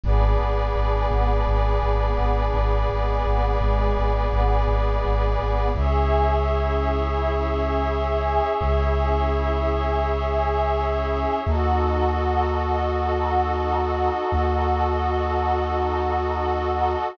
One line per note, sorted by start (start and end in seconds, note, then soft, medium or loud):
0.04 0.34 G#1 loud
0.04 2.87 B3 medium
0.04 2.87 D4 medium
0.04 5.70 G#4 medium
0.04 2.87 G#4 medium
0.04 5.70 B4 medium
0.04 5.70 D5 medium
0.39 0.70 G#1 medium
0.75 1.05 G#1 medium
1.11 1.41 G#1 medium
1.46 1.77 G#1 medium
1.82 2.12 G#1 medium
2.18 2.48 G#1 medium
2.54 2.84 G#1 medium
2.89 3.20 G#1 medium
2.89 5.71 G#3 medium
2.89 5.71 B3 medium
2.89 5.71 G#4 medium
3.25 3.55 G#1 medium
3.61 3.91 G#1 medium
3.97 4.27 G#1 medium
4.32 4.63 G#1 medium
4.68 4.98 G#1 medium
5.04 5.34 G#1 medium
5.39 5.69 G#1 medium
5.74 8.38 C#2 medium
5.74 11.40 C#4 loud
5.74 11.40 E4 medium
5.74 11.40 G#4 medium
5.74 11.40 C#5 medium
5.74 11.40 E5 medium
8.61 11.24 C#2 medium
11.45 14.09 D#2 medium
11.45 17.11 D#4 medium
11.45 17.11 F#4 medium
11.45 17.13 F#4 medium
11.45 17.11 A4 medium
11.45 17.13 A4 medium
11.45 17.13 D#5 medium
14.32 16.95 D#2 medium